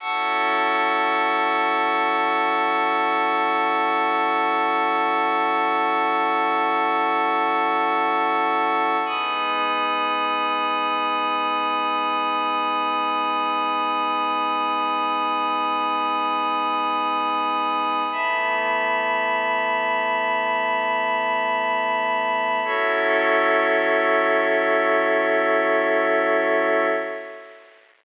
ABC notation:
X:1
M:4/4
L:1/8
Q:1/4=53
K:F#dor
V:1 name="Pad 5 (bowed)"
[F,CEA]8- | [F,CEA]8 | [G,B,D]8- | [G,B,D]8 |
[E,A,B,]8 | [F,CEA]8 |]
V:2 name="Pad 5 (bowed)"
[fac'e']8- | [fac'e']8 | [gbd']8- | [gbd']8 |
[eab]8 | [FAce]8 |]